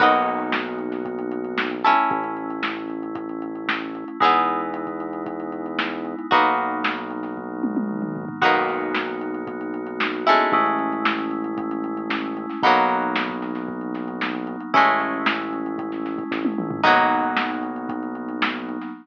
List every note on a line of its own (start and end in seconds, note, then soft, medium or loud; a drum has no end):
0.00 1.94 B1 medium
0.00 1.75 A#3 medium
0.00 1.75 B3 medium
0.00 1.75 D#4 medium
0.00 1.75 F#4 medium
0.00 1.75 A#4 medium
0.00 1.75 B4 medium
0.00 kick loud
0.00 crash loud
0.13 closed hi-hat medium
0.26 closed hi-hat medium
0.40 closed hi-hat medium
0.52 snare loud
0.65 closed hi-hat medium
0.79 closed hi-hat medium
0.92 snare soft
0.92 closed hi-hat medium
1.05 kick medium
1.05 closed hi-hat loud
1.19 closed hi-hat medium
1.31 closed hi-hat medium
1.45 closed hi-hat medium
1.58 snare loud
1.71 closed hi-hat medium
1.84 4.17 A3 medium
1.84 4.17 C#4 medium
1.84 4.17 E4 medium
1.84 4.17 A4 medium
1.84 snare soft
1.84 closed hi-hat medium
1.97 closed hi-hat medium
2.11 4.05 A1 medium
2.11 kick loud
2.11 closed hi-hat loud
2.24 closed hi-hat medium
2.37 closed hi-hat medium
2.50 closed hi-hat medium
2.63 snare loud
2.76 snare soft
2.76 closed hi-hat medium
2.90 closed hi-hat medium
3.03 closed hi-hat medium
3.15 kick loud
3.15 closed hi-hat loud
3.29 closed hi-hat medium
3.42 closed hi-hat medium
3.55 closed hi-hat medium
3.69 snare loud
3.81 closed hi-hat medium
3.95 closed hi-hat medium
4.08 closed hi-hat medium
4.20 6.15 E2 medium
4.20 6.27 G#3 medium
4.20 6.27 B3 medium
4.20 6.27 D#4 medium
4.20 6.28 D#4 medium
4.20 6.27 E4 medium
4.20 6.28 E4 medium
4.20 6.28 G#4 medium
4.20 kick loud
4.20 closed hi-hat loud
4.25 6.28 B3 medium
4.34 closed hi-hat medium
4.47 closed hi-hat medium
4.61 closed hi-hat medium
4.74 closed hi-hat loud
4.87 kick medium
4.87 closed hi-hat medium
5.00 closed hi-hat medium
5.13 closed hi-hat medium
5.26 kick medium
5.26 closed hi-hat loud
5.40 closed hi-hat medium
5.52 closed hi-hat medium
5.66 closed hi-hat medium
5.79 snare loud
5.92 closed hi-hat medium
6.05 closed hi-hat medium
6.19 closed hi-hat medium
6.31 8.25 B1 medium
6.31 8.38 F#3 medium
6.31 8.38 A#3 medium
6.31 8.37 A#3 medium
6.31 8.38 B3 medium
6.31 8.37 B3 medium
6.31 8.38 D#4 medium
6.31 8.37 D#4 medium
6.31 8.37 F#4 medium
6.31 kick loud
6.31 closed hi-hat loud
6.45 closed hi-hat medium
6.58 closed hi-hat medium
6.71 closed hi-hat medium
6.84 snare loud
6.97 closed hi-hat medium
7.11 closed hi-hat medium
7.23 snare soft
7.23 closed hi-hat medium
7.37 kick medium
7.63 high tom medium
7.77 high tom medium
7.89 mid tom medium
8.02 mid tom loud
8.16 floor tom medium
8.29 floor tom loud
8.41 10.36 B1 medium
8.41 10.48 A#3 medium
8.41 10.17 A#3 medium
8.41 10.48 B3 medium
8.41 10.17 B3 medium
8.41 10.48 D#4 medium
8.41 10.17 D#4 medium
8.41 10.48 F#4 medium
8.41 10.17 F#4 medium
8.41 kick loud
8.41 crash loud
8.55 closed hi-hat medium
8.68 snare soft
8.68 closed hi-hat medium
8.81 closed hi-hat medium
8.94 snare loud
9.07 closed hi-hat medium
9.21 closed hi-hat loud
9.34 closed hi-hat medium
9.47 kick loud
9.47 closed hi-hat loud
9.61 closed hi-hat medium
9.74 closed hi-hat medium
9.87 closed hi-hat medium
10.00 snare loud
10.13 closed hi-hat medium
10.27 12.59 G#3 medium
10.27 12.59 A3 medium
10.27 12.59 C#4 medium
10.27 12.59 E4 medium
10.27 closed hi-hat medium
10.39 closed hi-hat medium
10.52 12.47 A1 medium
10.52 12.60 G#3 medium
10.52 12.60 A3 medium
10.52 12.60 C#4 medium
10.52 12.60 E4 medium
10.52 kick loud
10.52 closed hi-hat loud
10.66 closed hi-hat medium
10.79 closed hi-hat medium
10.93 closed hi-hat medium
11.05 snare loud
11.18 closed hi-hat medium
11.31 closed hi-hat medium
11.44 closed hi-hat medium
11.58 kick loud
11.58 closed hi-hat loud
11.71 closed hi-hat loud
11.84 closed hi-hat medium
11.97 closed hi-hat medium
12.10 snare loud
12.24 closed hi-hat medium
12.37 closed hi-hat medium
12.49 snare soft
12.49 closed hi-hat medium
12.63 14.57 B1 medium
12.63 14.70 F#3 medium
12.63 14.70 A#3 medium
12.63 14.70 B3 medium
12.63 14.70 D#4 medium
12.63 kick loud
12.63 closed hi-hat loud
12.76 closed hi-hat medium
12.89 snare soft
12.89 closed hi-hat medium
13.02 closed hi-hat loud
13.16 snare loud
13.29 kick medium
13.29 closed hi-hat medium
13.42 snare soft
13.42 closed hi-hat medium
13.55 snare soft
13.55 closed hi-hat medium
13.68 kick medium
13.81 closed hi-hat medium
13.95 snare soft
13.95 closed hi-hat loud
14.08 closed hi-hat medium
14.21 snare loud
14.35 closed hi-hat medium
14.47 closed hi-hat loud
14.60 closed hi-hat medium
14.74 16.24 A1 medium
14.74 16.80 G#3 medium
14.74 16.80 A3 medium
14.74 16.80 C#4 medium
14.74 16.80 E4 medium
14.74 kick loud
14.74 closed hi-hat loud
14.87 closed hi-hat medium
15.00 snare soft
15.00 closed hi-hat loud
15.13 closed hi-hat medium
15.26 snare loud
15.39 closed hi-hat medium
15.53 closed hi-hat medium
15.66 closed hi-hat medium
15.78 kick medium
15.78 closed hi-hat loud
15.92 snare soft
15.92 closed hi-hat medium
16.06 snare soft
16.06 closed hi-hat medium
16.18 kick loud
16.18 closed hi-hat medium
16.31 16.55 A1 medium
16.31 kick loud
16.31 snare medium
16.45 high tom medium
16.58 16.82 A#1 medium
16.58 mid tom loud
16.71 floor tom loud
16.83 18.78 B1 medium
16.83 18.90 F#3 medium
16.83 18.90 A#3 medium
16.83 18.90 B3 medium
16.83 18.90 D#4 medium
16.83 kick loud
16.83 crash loud
16.97 snare soft
16.97 closed hi-hat medium
17.11 closed hi-hat medium
17.23 closed hi-hat medium
17.37 snare loud
17.51 closed hi-hat medium
17.63 closed hi-hat medium
17.76 closed hi-hat medium
17.89 kick loud
17.89 closed hi-hat loud
18.03 closed hi-hat medium
18.15 closed hi-hat medium
18.29 closed hi-hat medium
18.42 snare loud
18.55 closed hi-hat medium
18.69 closed hi-hat medium
18.81 snare soft
18.81 closed hi-hat medium